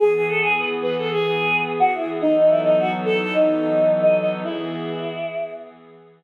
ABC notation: X:1
M:4/4
L:1/16
Q:1/4=108
K:E
V:1 name="Choir Aahs"
G G A G B z B A G4 z F E z | D D E D F z A A D4 z d d z | E8 z8 |]
V:2 name="Pad 5 (bowed)"
[E,B,G]16 | [E,F,B,DA]16 | [E,B,G]16 |]